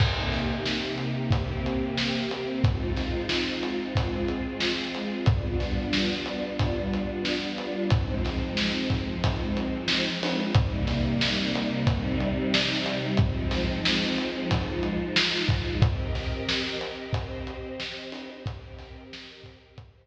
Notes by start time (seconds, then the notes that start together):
0.00 C3 A#3 D#4 G4, kick, crash
0.32 snare, closed hi-hat
0.66 snare
0.98 closed hi-hat
1.31 C3 A#3 C4 G4, kick, closed hi-hat
1.66 closed hi-hat
1.97 snare
2.31 closed hi-hat
2.64 G#3 C4 D#4 F4, kick, closed hi-hat
2.97 snare, closed hi-hat
3.29 snare
3.63 closed hi-hat
3.95 G#3 C4 F4 G#4, kick, closed hi-hat
4.28 closed hi-hat
4.60 snare
4.95 closed hi-hat
5.26 G3 B3 D4 F4, kick, closed hi-hat
5.60 snare, closed hi-hat
5.93 snare
6.26 closed hi-hat
6.59 kick, closed hi-hat
6.93 closed hi-hat
7.25 snare
7.58 closed hi-hat
7.90 F3 G#3 C4 D#4, kick, closed hi-hat
8.25 snare, closed hi-hat
8.57 snare
8.90 kick, closed hi-hat
9.24 kick, closed hi-hat
9.57 closed hi-hat
9.88 snare
10.23 open hi-hat
10.54 C3 G3 A#3 D#4, kick, closed hi-hat
10.87 snare, closed hi-hat
11.21 snare
11.55 closed hi-hat
11.87 C3 G3 C4 D#4, kick, closed hi-hat
12.20 closed hi-hat
12.54 snare
12.86 closed hi-hat
13.17 F3 G#3 C4 D#4, kick, closed hi-hat
13.51 snare, closed hi-hat
13.85 snare
14.18 closed hi-hat
14.51 F3 G#3 D#4 F4, kick, closed hi-hat
14.83 closed hi-hat
15.16 snare
15.49 kick, closed hi-hat
15.82 C4 G4 A#4 D#5, kick, closed hi-hat
16.15 snare, closed hi-hat
16.48 snare
16.81 closed hi-hat
17.13 C4 G4 C5 D#5, kick, closed hi-hat
17.47 closed hi-hat
17.80 snare
18.12 open hi-hat
18.46 C4 G4 A#4 D#5, kick, closed hi-hat
18.79 snare, closed hi-hat
19.13 snare
19.44 kick, closed hi-hat
19.78 C4 G4 C5 D#5, kick, closed hi-hat